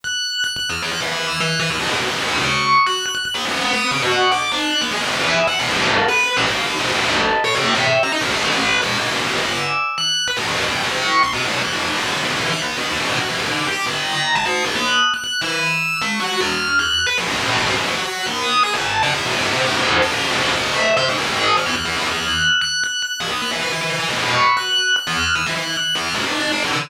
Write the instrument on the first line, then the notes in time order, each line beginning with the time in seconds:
tubular bells
0.04 F#6
0.44 F#6
0.56 F#6
0.70 F6
0.82 F#6
0.91 F#6
1.00 E6
1.40 F#6
1.60 E6
1.70 F6
1.79 D#6
1.89 C#6
1.99 F#6
2.09 E6
2.18 D#6
2.38 C#6
2.87 F#6
3.06 F#6
3.15 F#6
3.25 F#6
3.34 D#6
3.45 B5
3.73 D#6
3.91 C#6
4.02 F#5
4.32 D6
4.52 F#6
4.81 D#6
4.91 G#5
5.01 B5
5.10 E5
5.47 F#5
5.59 F5
5.69 A#4
5.78 A4
6.08 B4
6.37 A4
6.46 F5
6.66 D#5
6.79 B4
6.94 A4
7.05 A4
7.44 C#5
7.55 G5
7.75 E5
8.03 A#5
8.12 D#5
8.21 E5
8.31 A4
8.51 B4
8.81 F5
8.98 D5
9.10 G#5
9.29 D6
9.38 E6
9.98 F#6
10.28 B5
10.37 A5
10.47 A#5
10.56 F#5
10.65 G5
10.83 C#6
11.23 C6
11.33 D6
11.45 F6
11.62 F#6
11.72 D6
11.83 G5
11.98 A#5
12.11 D6
12.24 E6
12.36 F#6
12.52 F#6
12.62 D#6
12.77 F6
12.89 E6
12.98 C#6
13.19 F#6
13.28 E6
13.37 D6
13.67 G5
13.86 A#5
14.35 A5
14.45 D#6
14.65 F#6
14.75 F#6
15.14 F#6
15.24 F#6
15.41 E6
16.02 C#6
16.20 F#6
16.41 F6
16.79 F#6
17.06 B5
17.18 C6
17.27 A#5
17.38 A5
17.57 G#5
17.66 F#5
17.75 A#5
17.86 C#6
17.96 F#6
18.05 F#6
18.26 D#6
18.63 G#5
18.74 A5
19.03 F#5
19.14 E5
19.25 G5
19.39 C5
19.51 E5
19.65 A4
19.77 C5
20.02 A4
20.11 C5
20.31 A4
20.43 D#5
20.56 E5
20.97 C5
21.09 G#5
21.18 A5
21.27 D#6
21.57 F6
21.66 F#6
21.76 F#6
21.85 F6
21.96 E6
22.10 F#6
22.61 F#6
22.84 F#6
23.02 F#6
23.20 D#6
23.31 F#6
23.42 F#6
23.51 E6
23.61 F#6
23.72 F#6
23.81 E6
23.90 F#6
23.99 B5
24.09 C#6
24.57 F#6
24.96 F#6
25.07 F6
25.35 E6
25.47 F#6
25.56 F#6
25.77 F#6
25.95 F6
26.14 D6
26.25 F#6
26.40 F#6
26.52 D6
26.63 E6